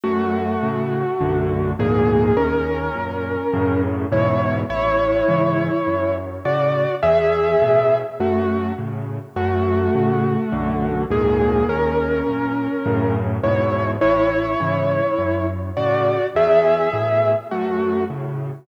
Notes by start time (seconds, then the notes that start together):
0.04 F#2 A3 F#4
0.63 A2 C#3
1.21 B1 F#2 D3
1.79 D2 F2 G#2 A#2 A#3 G#4
2.37 D#2 C#4 A#4
2.95 F#2 A#2
3.53 F#2 A2 C#3
4.12 E2 G#2 B2 E4 C#5
4.69 A1 E4 C#5
5.28 G#2 C#3 E3
5.87 F#2
6.45 A2 C#3 F#4 D5
7.03 E2 G#4 E5
7.62 A2 B2
8.20 F#2 A3 F#4
8.78 A2 C#3
9.36 F#2 A3 F#4
9.95 A2 C#3
10.52 B1 F#2 D3
11.10 D2 F2 G#2 A#2 A#3 G#4
11.68 D#2 C#4 A#4
12.27 F#2 A#2
12.86 F#2 A2 C#3
13.43 E2 G#2 B2 E4 C#5
14.01 A1 E4 C#5
14.60 G#2 C#3 E3
15.18 F#2
15.77 A2 C#3 F#4 D5
16.35 E2 G#4 E5
16.93 A2 B2
17.51 F#2 A3 F#4
18.10 A2 C#3